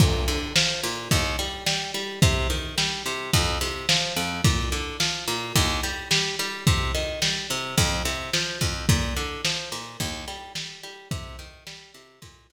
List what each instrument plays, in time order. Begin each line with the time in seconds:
0.00 acoustic guitar (steel) A#2, kick, crash
0.28 acoustic guitar (steel) D3, ride
0.56 acoustic guitar (steel) F3, snare
0.83 acoustic guitar (steel) A#2, ride
1.11 acoustic guitar (steel) D#2, kick, ride
1.39 acoustic guitar (steel) G3, ride
1.66 acoustic guitar (steel) G3, snare
1.94 acoustic guitar (steel) G3, ride
2.22 acoustic guitar (steel) C3, kick, ride
2.50 acoustic guitar (steel) D#3, ride
2.78 acoustic guitar (steel) G3, snare
3.06 acoustic guitar (steel) C3, ride
3.33 acoustic guitar (steel) F2, kick, ride
3.61 acoustic guitar (steel) C3, ride
3.89 acoustic guitar (steel) F3, snare
4.16 acoustic guitar (steel) F2, ride
4.44 acoustic guitar (steel) A#2, kick, ride
4.72 acoustic guitar (steel) D3, ride
5.00 acoustic guitar (steel) F3, snare
5.28 acoustic guitar (steel) A#2, ride
5.56 acoustic guitar (steel) D#2, kick, ride
5.83 acoustic guitar (steel) G3, ride
6.11 acoustic guitar (steel) G3, snare
6.39 acoustic guitar (steel) G3, ride
6.67 acoustic guitar (steel) C3, kick, ride
6.95 acoustic guitar (steel) D#3, ride
7.22 acoustic guitar (steel) G3, snare
7.50 acoustic guitar (steel) C3, ride
7.78 acoustic guitar (steel) F2, kick, ride
8.05 acoustic guitar (steel) C3, ride
8.33 acoustic guitar (steel) F3, snare
8.61 acoustic guitar (steel) F2, kick, ride
8.89 acoustic guitar (steel) A#2, kick, ride
9.16 acoustic guitar (steel) D3, ride
9.45 acoustic guitar (steel) F3, snare
9.72 acoustic guitar (steel) A#2, ride
10.00 acoustic guitar (steel) D#2, kick, ride
10.28 acoustic guitar (steel) G3, ride
10.55 acoustic guitar (steel) G3, snare
10.83 acoustic guitar (steel) G3, ride
11.11 acoustic guitar (steel) C3, kick, ride
11.39 acoustic guitar (steel) D#3, ride
11.67 acoustic guitar (steel) G3, snare
11.94 acoustic guitar (steel) C3, ride
12.22 acoustic guitar (steel) A#2, kick, ride
12.50 acoustic guitar (steel) D3, ride